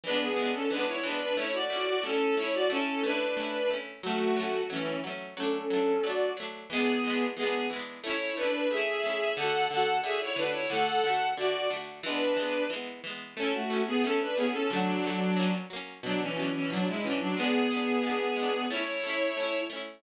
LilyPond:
<<
  \new Staff \with { instrumentName = "Violin" } { \time 2/4 \key a \major \tempo 4 = 90 <d' b'>16 <b gis'>8 <cis' a'>16 <d' b'>16 <e' cis''>16 <d' b'>16 <d' b'>16 | <e' cis''>16 <fis' d''>8 <fis' d''>16 <cis' a'>8 <e' cis''>16 <fis' d''>16 | <cis' a'>8 <d' b'>4 r8 | <a fis'>4 <e cis'>8 r8 |
<cis' a'>4 <fis' d''>8 r8 | <b gis'>4 <b gis'>8 r8 | <e' cis''>8 <d' b'>8 <gis' e''>4 | <a' fis''>8 <a' fis''>8 <gis' e''>16 <e' cis''>16 <d' b'>16 <e' cis''>16 |
<a' fis''>4 <fis' d''>8 r8 | <d' b'>4 r4 | <cis' a'>16 <a fis'>8 <b gis'>16 <cis' a'>16 <d' b'>16 <b gis'>16 <cis' a'>16 | <fis d'>4. r8 |
<fis d'>16 <e cis'>8 <e cis'>16 <fis d'>16 <gis e'>16 <e cis'>16 <fis d'>16 | <b gis'>2 | <e' cis''>4. r8 | }
  \new Staff \with { instrumentName = "Pizzicato Strings" } { \time 2/4 \key a \major <e gis b d'>8 <e gis b d'>8 <e gis b d'>8 <e gis b d'>8 | <a cis' e'>8 <a cis' e'>8 <a cis' e'>8 <a cis' e'>8 | <a cis' e'>8 <a cis' e'>8 <a cis' e'>8 <a cis' e'>8 | <fis a cis'>8 <fis a cis'>8 <fis a cis'>8 <fis a cis'>8 |
<fis a d'>8 <fis a d'>8 <fis a d'>8 <fis a d'>8 | <e gis b d'>8 <e gis b d'>8 <e gis b d'>8 <e gis b d'>8 | <a cis' e'>8 <a cis' e'>8 <a cis' e'>8 <a cis' e'>8 | <d a fis'>8 <d a fis'>8 <d a fis'>8 <d a fis'>8 |
<d a fis'>8 <d a fis'>8 <d a fis'>8 <d a fis'>8 | <e gis b>8 <e gis b>8 <e gis b>8 <e gis b>8 | <a cis' e'>8 <a cis' e'>8 <a cis' e'>8 <a cis' e'>8 | <d a fis'>8 <d a fis'>8 <fis ais cis'>8 <fis ais cis'>8 |
<b, fis d'>8 <b, fis d'>8 <b, fis d'>8 <b, fis d'>8 | <gis b d'>8 <gis b d'>8 <gis b d'>8 <gis b d'>8 | <a cis' e'>8 <a cis' e'>8 <a cis' e'>8 <a cis' e'>8 | }
>>